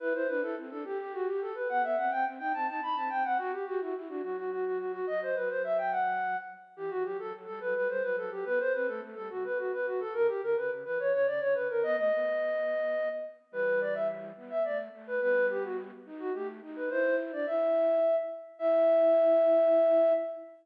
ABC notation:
X:1
M:6/8
L:1/16
Q:3/8=71
K:Em
V:1 name="Flute"
B c B A z A G G F G A B | f e f g z g a a b a g f | F G F F z F F F F F F F | ^d c B c e g f4 z2 |
G F G A z A B B c B A G | B c B A z A F B F B F A | ^A G A B z B ^c c d c B A | ^d d9 z2 |
B2 d e z3 e d z2 B | B2 G F z3 F G z2 B | c2 z d e6 z2 | e12 |]
V:2 name="Flute"
E E D E C D G6 | B, B, C C C ^D C D D C C C | F z G E E D F,6 | F,2 F,8 z2 |
E, E, F, F, F, G, F, G, G, F, F, F, | B, z C A, A, G, C,6 | ^C, z D, C, C, E, E, C, C, D, C, D, | B, A, B,8 z2 |
[E,G,]6 B,2 A,2 A,2 | [G,B,]6 ^D2 A,2 D2 | E3 D E4 z4 | E12 |]